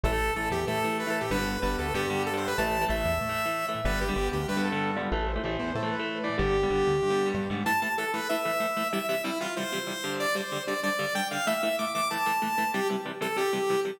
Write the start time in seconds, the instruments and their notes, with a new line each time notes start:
0.04 synth bass 1 A1, overdriven guitar E3 A3, lead 2 (sawtooth) A4
0.12 overdriven guitar E3 A3
0.36 synth bass 1 A1, overdriven guitar E3 A3, lead 2 (sawtooth) A4
0.51 synth bass 1 E2, lead 2 (sawtooth) G4
0.67 synth bass 1 A2, overdriven guitar E3 A3, lead 2 (sawtooth) A4
0.84 overdriven guitar E3 A3
0.99 lead 2 (sawtooth) B4
1.07 overdriven guitar E3 A3, lead 2 (sawtooth) A4
1.21 lead 2 (sawtooth) G4
1.31 synth bass 1 G1, overdriven guitar D3 G3 B3, lead 2 (sawtooth) B4
1.38 overdriven guitar D3 G3 B3
1.62 synth bass 1 G1, overdriven guitar D3 G3 B3, lead 2 (sawtooth) B4
1.78 synth bass 1 D2, lead 2 (sawtooth) A4
1.94 synth bass 1 G2, overdriven guitar D3 G3 B3, lead 2 (sawtooth) G4
2.10 overdriven guitar D3 G3 B3
2.26 lead 2 (sawtooth) A4
2.33 overdriven guitar D3 G3 B3, lead 2 (sawtooth) C5
2.47 lead 2 (sawtooth) B4
2.58 synth bass 1 A1, overdriven guitar E3 A3, lead 2 (sawtooth) A5
2.81 overdriven guitar E3 A3
2.88 synth bass 1 A1, overdriven guitar E3 A3, lead 2 (sawtooth) E5
3.05 synth bass 1 E2
3.21 synth bass 1 A2
3.29 overdriven guitar E3 A3
3.46 overdriven guitar E3 A3
3.68 overdriven guitar E3 A3
3.85 synth bass 1 G1, overdriven guitar D3 G3 B3, lead 2 (sawtooth) B4
4.01 lead 2 (sawtooth) G4
4.09 overdriven guitar D3 G3 B3
4.16 synth bass 1 G1, overdriven guitar D3 G3 B3
4.33 synth bass 1 D2, lead 2 (sawtooth) G4
4.48 synth bass 1 G2, lead 2 (sawtooth) B4
4.57 overdriven guitar D3 G3 B3
4.64 lead 2 (sawtooth) A4
4.72 overdriven guitar D3 G3 B3
4.96 overdriven guitar D3 G3 B3, lead 2 (sawtooth) F4
5.12 synth bass 1 A1, overdriven guitar E3 A3, lead 2 (sawtooth) A4
5.27 lead 2 (sawtooth) C5
5.36 overdriven guitar E3 A3
5.44 synth bass 1 A1, overdriven guitar E3 A3
5.59 synth bass 1 E2, lead 2 (sawtooth) C5
5.75 synth bass 1 A2, lead 2 (sawtooth) A4
5.83 overdriven guitar E3 A3
5.91 lead 2 (sawtooth) B4
5.99 overdriven guitar E3 A3
6.23 overdriven guitar E3 A3, lead 2 (sawtooth) D5
6.38 synth bass 1 G1, overdriven guitar D3 G3 B3, lead 2 (sawtooth) G4
6.63 overdriven guitar D3 G3 B3
6.70 synth bass 1 G1, overdriven guitar D3 G3 B3
6.87 synth bass 1 D2
7.02 synth bass 1 G2
7.10 overdriven guitar D3 G3 B3
7.26 overdriven guitar D3 G3 B3
7.34 synth bass 1 G2
7.50 synth bass 1 G#2, overdriven guitar D3 G3 B3
7.66 overdriven guitar A2 E3 A3, lead 2 (sawtooth) A5
7.82 overdriven guitar A2 E3 A3, lead 2 (sawtooth) A5
7.98 overdriven guitar A2 E3 A3, lead 2 (sawtooth) A4
8.13 overdriven guitar A2 E3 A3, lead 2 (sawtooth) B4
8.29 overdriven guitar A2 E3 A3, lead 2 (sawtooth) E5
8.45 overdriven guitar A2 E3 A3
8.60 overdriven guitar A2 E3 A3
8.77 overdriven guitar A2 E3 A3
8.93 overdriven guitar C3 E3 G3, lead 2 (sawtooth) E5
9.09 overdriven guitar C3 E3 G3, lead 2 (sawtooth) E5
9.24 overdriven guitar C3 E3 G3, lead 2 (sawtooth) E4
9.40 overdriven guitar C3 E3 G3, lead 2 (sawtooth) F4
9.56 overdriven guitar C3 E3 G3, lead 2 (sawtooth) C5
9.72 overdriven guitar C3 E3 G3
9.87 overdriven guitar C3 E3 G3
10.04 overdriven guitar G2 D3 G3
10.20 lead 2 (sawtooth) D5
10.35 overdriven guitar G2 D3 G3, lead 2 (sawtooth) C5
10.52 overdriven guitar G2 D3 G3
10.67 overdriven guitar G2 D3 G3, lead 2 (sawtooth) D5
10.83 overdriven guitar G2 D3 G3, lead 2 (sawtooth) D5
10.99 overdriven guitar G2 D3 G3
11.15 overdriven guitar G2 D3 G3, lead 2 (sawtooth) G5
11.31 overdriven guitar G2 D3 G3, lead 2 (sawtooth) F5
11.47 overdriven guitar A2 E3 A3, lead 2 (sawtooth) E5
11.62 overdriven guitar A2 E3 A3, lead 2 (sawtooth) E5
11.79 overdriven guitar A2 E3 A3, lead 2 (sawtooth) D6
11.94 overdriven guitar A2 E3 A3, lead 2 (sawtooth) D6
12.10 overdriven guitar A2 E3 A3, lead 2 (sawtooth) A5
12.26 overdriven guitar A2 E3 A3
12.42 overdriven guitar A2 E3 A3
12.58 overdriven guitar A2 E3 A3
12.74 overdriven guitar C3 E3 G3, lead 2 (sawtooth) G4
12.90 overdriven guitar C3 E3 G3
13.05 overdriven guitar C3 E3 G3
13.21 overdriven guitar C3 E3 G3, lead 2 (sawtooth) A4
13.36 overdriven guitar C3 E3 G3, lead 2 (sawtooth) G4
13.53 overdriven guitar C3 E3 G3
13.70 overdriven guitar C3 E3 G3
13.85 overdriven guitar C3 E3 G3